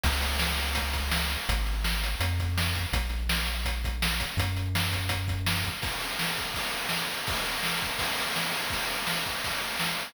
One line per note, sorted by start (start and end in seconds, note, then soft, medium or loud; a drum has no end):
0.04 1.37 C#2 loud
0.04 kick loud
0.04 crash loud
0.22 closed hi-hat loud
0.39 snare loud
0.60 closed hi-hat loud
0.75 kick loud
0.75 closed hi-hat loud
0.93 kick loud
0.93 closed hi-hat loud
1.11 snare loud
1.30 closed hi-hat loud
1.49 2.15 G#1 loud
1.49 kick loud
1.49 closed hi-hat loud
1.66 closed hi-hat medium
1.84 snare loud
2.04 closed hi-hat loud
2.20 2.86 F2 loud
2.20 kick loud
2.20 closed hi-hat loud
2.40 kick loud
2.40 closed hi-hat loud
2.58 snare loud
2.75 kick loud
2.75 closed hi-hat medium
2.93 4.26 A#1 loud
2.93 kick loud
2.93 closed hi-hat loud
3.09 closed hi-hat medium
3.29 snare loud
3.46 closed hi-hat loud
3.65 kick loud
3.65 closed hi-hat loud
3.84 kick loud
3.84 closed hi-hat loud
4.02 snare loud
4.20 kick loud
4.20 closed hi-hat loud
4.37 5.70 F#2 loud
4.37 kick loud
4.37 closed hi-hat loud
4.57 closed hi-hat medium
4.75 snare loud
4.93 kick loud
4.93 closed hi-hat loud
5.09 kick loud
5.09 closed hi-hat loud
5.28 kick loud
5.28 closed hi-hat medium
5.47 snare loud
5.64 kick loud
5.64 closed hi-hat medium
5.82 kick loud
5.82 crash loud
6.00 ride medium
6.19 snare loud
6.37 kick medium
6.37 ride medium
6.54 kick loud
6.54 ride loud
6.73 ride medium
6.89 snare loud
7.11 ride medium
7.27 kick loud
7.27 ride loud
7.46 ride medium
7.63 snare loud
7.82 kick medium
7.82 ride medium
7.99 kick loud
7.99 ride loud
8.18 ride medium
8.36 snare loud
8.52 ride loud
8.70 kick loud
8.70 ride loud
8.90 ride medium
9.07 snare loud
9.26 kick medium
9.26 ride medium
9.44 kick medium
9.44 ride loud
9.62 ride medium
9.79 snare loud
9.99 ride medium